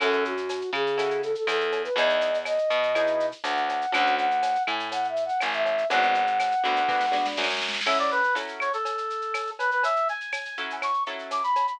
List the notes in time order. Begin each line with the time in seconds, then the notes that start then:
0.00 F#2 C#4 E4 F#4 A4, cowbell, claves, shaker
0.13 shaker
0.25 F#4, shaker
0.37 shaker
0.49 tambourine, cowbell, shaker
0.61 shaker
0.73 C#3 G#4, claves, shaker
0.86 shaker
0.98 C#4 E4 F#4 A4, cowbell, shaker
1.10 shaker
1.23 A4, shaker
1.35 A4, shaker
1.47 E2 A4, tambourine, cowbell, claves, shaker
1.60 shaker
1.72 cowbell, shaker
1.84 B4, shaker
1.96 E2 B3 D#4 E4 G#4 D#5, cowbell, shaker
2.09 shaker
2.21 shaker
2.34 shaker
2.45 D#5, tambourine, cowbell, claves, shaker
2.58 shaker
2.70 B2, shaker
2.83 shaker
2.95 B3 D#4 E4 G#4, cowbell, claves, shaker
3.07 shaker
3.20 shaker
3.32 shaker
3.44 D2 F#5, tambourine, cowbell, shaker
3.57 shaker
3.69 cowbell, shaker
3.81 shaker
3.92 D2 C#4 D4 F#4 A4 F#5, cowbell, claves, shaker
4.06 shaker
4.17 F#5, shaker
4.31 shaker
4.43 tambourine, cowbell, shaker
4.55 shaker
4.67 A2 G#5, claves, shaker
4.80 shaker
4.91 F#5, cowbell, shaker
5.04 shaker
5.08 E5
5.16 shaker
5.25 F#5, shaker
5.40 G#1 G#5, tambourine, cowbell, claves, shaker
5.53 E5, shaker
5.66 cowbell, shaker
5.78 shaker
5.90 G#1 B3 D4 F#4 G#4 F#5, cowbell, shaker
6.03 shaker
6.14 shaker
6.27 shaker
6.40 tambourine, cowbell, claves, shaker
6.52 shaker
6.64 D2 B3 D4 F#4 G#4, shaker
6.76 shaker
6.89 B3 D4 F#4 G#4, kick, snare
7.01 snare
7.12 B3 D4 F#4 G#4, snare
7.26 snare
7.37 F#2, snare
7.44 snare
7.50 snare
7.57 snare
7.62 snare
7.69 snare
7.74 snare
7.81 snare
7.86 F#3 C#4 E4 A4 E5, crash, cowbell, claves
7.99 D5, shaker
8.11 B4, shaker
8.23 shaker
8.35 F#3 C#4 E4 A4, tambourine, cowbell, shaker
8.48 shaker
8.60 C#5, claves, shaker
8.73 A4, shaker
8.85 cowbell, shaker
8.98 shaker
9.10 shaker
9.22 shaker
9.34 tambourine, cowbell, claves, shaker
9.47 shaker
9.59 B4, cowbell, shaker
9.71 B4, shaker
9.83 E5, cowbell, shaker
9.96 shaker
10.08 G#5, shaker
10.20 shaker
10.32 tambourine, cowbell, claves, shaker
10.45 shaker
10.57 F#3 C#4 E4 A4, shaker
10.70 shaker
10.82 C#6, cowbell, claves, shaker
10.94 shaker
11.06 F#3 C#4 E4 A4, shaker
11.19 shaker
11.31 D6, tambourine, cowbell, shaker
11.43 B5, shaker
11.56 cowbell, shaker
11.67 B5, shaker